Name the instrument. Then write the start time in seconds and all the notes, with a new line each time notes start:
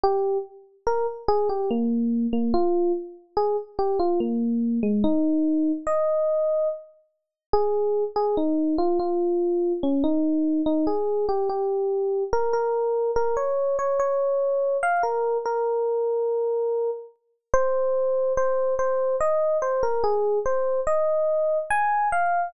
electric piano 1
0.03 G4
0.87 A#4
1.28 G#4
1.49 G4
1.71 A#3
2.33 A#3
2.54 F4
3.37 G#4
3.79 G4
3.99 F4
4.20 A#3
4.83 G#3
5.04 D#4
5.87 D#5
7.53 G#4
8.16 G#4
8.37 D#4
8.78 F4
8.99 F4
9.83 C#4
10.04 D#4
10.66 D#4
10.87 G#4
11.29 G4
11.49 G4
12.33 A#4
12.53 A#4
13.16 A#4
13.37 C#5
13.79 C#5
13.99 C#5
14.83 F5
15.03 A#4
15.45 A#4
17.54 C5
18.37 C5
18.79 C5
19.20 D#5
19.62 C5
19.83 A#4
20.04 G#4
20.46 C5
20.87 D#5
21.70 G#5
22.12 F5